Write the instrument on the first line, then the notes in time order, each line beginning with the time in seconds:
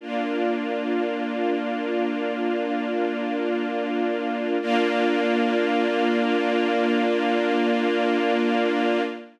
string ensemble 1
0.01 A#3 D4 F4
4.61 A#3 D4 F4